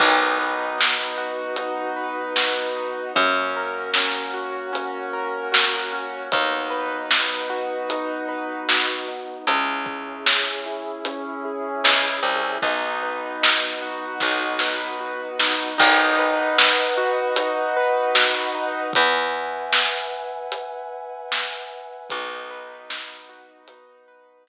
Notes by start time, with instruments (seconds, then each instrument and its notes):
0.00 electric bass (finger) B1, brass section B3 D#4 F#4, acoustic grand piano D#4, kick, crash
0.39 acoustic grand piano B4
0.78 acoustic grand piano D#4, snare
1.18 acoustic grand piano F#4
1.56 acoustic grand piano D#4, closed hi-hat
1.96 acoustic grand piano B4
2.36 acoustic grand piano F#4, snare
2.76 acoustic grand piano D#4
3.15 electric bass (finger) F#2, brass section A#3 C#4 F#4, acoustic grand piano C#4, kick, closed hi-hat
3.56 acoustic grand piano A#4
3.94 acoustic grand piano C#4, snare
4.34 acoustic grand piano F#4
4.73 acoustic grand piano C#4, closed hi-hat
5.13 acoustic grand piano A#4
5.52 acoustic grand piano F#4, snare
5.92 acoustic grand piano C#4
6.32 electric bass (finger) D#2, brass section B3 D#4 F#4, acoustic grand piano D#4, kick, closed hi-hat
6.70 acoustic grand piano B4
7.10 acoustic grand piano D#4, snare
7.50 acoustic grand piano F#4
7.89 acoustic grand piano D#4, closed hi-hat
8.29 acoustic grand piano B4
8.69 acoustic grand piano F#4, snare
9.08 acoustic grand piano D#4
9.47 electric bass (finger) C#2, acoustic grand piano C#4, brass section C#4 E4 G#4, closed hi-hat
9.86 acoustic grand piano G#4, kick
10.26 acoustic grand piano C#4, snare
10.66 acoustic grand piano E4
11.05 acoustic grand piano C#4, closed hi-hat
11.45 acoustic grand piano G#4
11.84 electric bass (finger) C#2, acoustic grand piano E4, snare
12.23 electric bass (finger) C2, acoustic grand piano C#4
12.62 electric bass (finger) B1, brass section B3 D#4 F#4, acoustic grand piano D#4, kick, closed hi-hat
13.03 acoustic grand piano B4
13.42 acoustic grand piano D#4, snare
13.82 acoustic grand piano F#4
14.20 electric bass (finger) B1, acoustic grand piano D#4, kick, snare
14.59 acoustic grand piano B4, snare
15.00 acoustic grand piano F#4
15.39 acoustic grand piano D#4, snare
15.78 electric bass (finger) B1, acoustic grand piano D#4, brass section B4 D#5 F#5, kick, crash
16.18 acoustic grand piano B4
16.58 acoustic grand piano D#4, snare
16.97 acoustic grand piano F#4
17.36 acoustic grand piano D#4, closed hi-hat
17.76 acoustic grand piano B4
18.15 acoustic grand piano F#4, snare
18.55 acoustic grand piano D#4
18.93 electric bass (finger) E2, brass section B4 E5 F#5 G#5, kick, closed hi-hat
19.73 snare
20.52 closed hi-hat
21.32 snare
22.10 electric bass (finger) B1, brass section B3 D#4 F#4, acoustic grand piano D#4, kick, closed hi-hat
22.50 acoustic grand piano B4
22.89 acoustic grand piano D#4, snare
23.29 acoustic grand piano F#4
23.68 brass section B3 F#4 B4, acoustic grand piano D#4, closed hi-hat
24.08 acoustic grand piano B4
24.47 acoustic grand piano F#4, snare